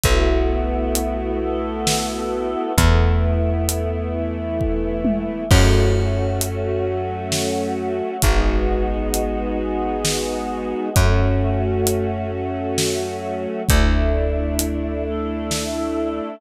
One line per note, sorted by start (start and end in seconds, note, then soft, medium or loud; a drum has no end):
0.04 2.56 B1 medium
0.04 1.40 A3 medium
0.04 2.73 A3 medium
0.04 1.40 B3 medium
0.04 2.73 B3 medium
0.04 1.40 E4 medium
0.04 2.73 E4 medium
0.04 1.40 F#4 medium
0.04 2.73 F#4 medium
0.04 kick medium
0.04 closed hi-hat medium
0.95 closed hi-hat medium
1.41 2.76 A3 medium
1.41 2.76 B3 medium
1.41 2.76 F#4 medium
1.41 2.76 A4 medium
1.87 snare loud
2.77 5.29 E2 loud
2.77 5.45 A3 medium
2.77 4.13 A3 medium
2.77 5.45 B3 medium
2.77 4.13 B3 medium
2.77 5.45 E4 medium
2.77 4.13 E4 medium
2.77 kick medium
2.77 closed hi-hat loud
3.69 closed hi-hat loud
4.14 5.49 E3 medium
4.14 5.49 A3 medium
4.14 5.49 E4 medium
4.61 kick medium
5.05 high tom loud
5.49 8.02 F#2 loud
5.49 8.17 A3 medium
5.49 6.85 A3 medium
5.49 8.17 C#4 medium
5.49 6.85 C#4 medium
5.49 8.17 F#4 medium
5.49 6.85 F#4 medium
5.49 kick loud
5.49 crash loud
6.41 closed hi-hat loud
6.87 8.22 F#3 medium
6.87 8.22 A3 medium
6.87 8.22 F#4 medium
7.32 snare medium
8.22 10.74 G#1 medium
8.22 10.89 G#3 medium
8.22 9.58 G#3 medium
8.22 10.89 B3 medium
8.22 9.58 B3 medium
8.22 10.89 D#4 medium
8.22 9.58 D#4 medium
8.22 10.89 F#4 medium
8.22 9.58 F#4 medium
8.22 kick medium
8.22 closed hi-hat loud
9.14 closed hi-hat medium
9.59 10.95 G#3 medium
9.59 10.95 B3 medium
9.59 10.95 F#4 medium
9.59 10.95 G#4 medium
10.05 snare loud
10.95 13.47 F#2 medium
10.95 13.63 A3 medium
10.95 12.31 A3 medium
10.95 13.63 C#4 medium
10.95 12.31 C#4 medium
10.95 13.63 F#4 medium
10.95 12.31 F#4 medium
10.95 kick loud
10.95 closed hi-hat loud
11.87 closed hi-hat medium
12.32 13.67 F#3 medium
12.32 13.67 A3 medium
12.32 13.67 F#4 medium
12.78 snare loud
13.69 16.21 D2 loud
13.69 15.04 A3 medium
13.69 16.36 A3 medium
13.69 15.04 D4 medium
13.69 16.36 D4 medium
13.69 15.04 E4 medium
13.69 16.36 E4 medium
13.69 kick loud
13.69 closed hi-hat loud
14.59 closed hi-hat loud
15.05 16.40 A3 medium
15.05 16.40 E4 medium
15.05 16.40 A4 medium
15.51 snare medium